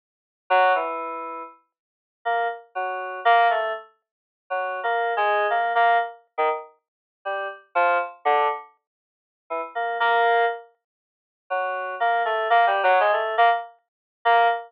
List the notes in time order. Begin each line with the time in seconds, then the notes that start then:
0.50 F#3
0.75 E3
2.25 A#3
2.75 F#3
3.25 A#3
3.50 A3
4.50 F#3
4.83 A#3
5.17 G#3
5.50 A#3
5.75 A#3
6.38 D#3
7.25 G3
7.75 F3
8.25 D3
9.50 E3
9.75 A#3
10.00 A#3
11.50 F#3
12.00 A#3
12.25 A3
12.50 A#3
12.67 G3
12.83 F#3
13.00 G#3
13.13 A3
13.38 A#3
14.25 A#3